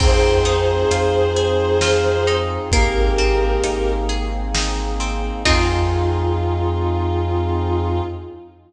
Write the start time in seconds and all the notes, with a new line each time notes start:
0.00 F2 C4 D#4 F4 G#4 C5, kick, crash
0.45 D#4, closed hi-hat
0.91 F2 F4, closed hi-hat
1.36 G#4, closed hi-hat
1.81 F4, snare
2.27 D#4, closed hi-hat
2.71 G#1 A#3 C4 D#4 G4 G#4 A#4, kick, closed hi-hat
3.18 C4, closed hi-hat
3.64 G#1 D#4, closed hi-hat
4.09 G#4, closed hi-hat
4.55 D#4, snare
5.00 C4, closed hi-hat
5.45 F2 C4 D#4 F4 G#4, kick, crash